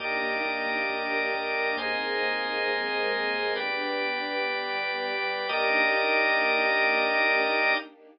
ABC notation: X:1
M:4/4
L:1/8
Q:1/4=135
K:Eb
V:1 name="String Ensemble 1"
[B,DEG]4 [B,DGB]4 | [B,CEA]4 [A,B,CA]4 | "^rit." [=B,DG]4 [G,B,G]4 | [B,DEG]8 |]
V:2 name="Drawbar Organ"
[GBde]8 | [ABce]8 | "^rit." [G=Bd]8 | [GBde]8 |]
V:3 name="Synth Bass 1" clef=bass
E,, E,, E,, E,, E,, E,, E,, E,, | E,, E,, E,, E,, E,, E,, E,, E,, | "^rit." G,,, G,,, G,,, G,,, G,,, G,,, G,,, G,,, | E,,8 |]